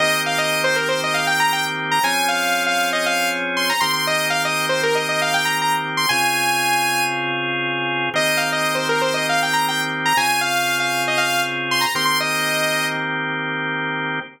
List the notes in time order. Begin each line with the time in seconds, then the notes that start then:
0.00 D#3 A#3 C4 G4 D#5
0.26 F5
0.38 D#5
0.64 C5
0.76 A#4
0.89 C5
1.04 D#5
1.14 F5
1.27 G5
1.40 A#5
1.53 G5
1.91 A#5
2.03 F3 C4 C#4 G#4 G#5
2.28 F5
2.66 F5
2.93 D#5
3.06 F5
3.57 C6
3.69 A#5
3.81 D#3 A#3 C4 G4 C6
3.93 C6
4.07 D#5
4.30 F5
4.45 D#5
4.69 C5
4.83 A#4
4.95 D#5
5.09 D#5
5.22 F5
5.34 G5
5.45 A#5
5.62 A#5
5.97 C6
6.09 C#3 C4 F4 G#4 G#5
8.14 D#3 A#3 C4 G4 D#5
8.37 F5
8.52 D#5
8.75 C5
8.89 A#4
9.01 C5
9.14 D#5
9.29 F5
9.43 G5
9.53 A#5
9.68 G5
10.06 A#5
10.17 C#3 C4 F4 G#4 G#5
10.41 F5
10.80 F5
11.08 D#5
11.18 F5
11.71 C6
11.81 A#5
11.95 D#3 A#3 C4 G4 C6
12.05 C6
12.20 D#5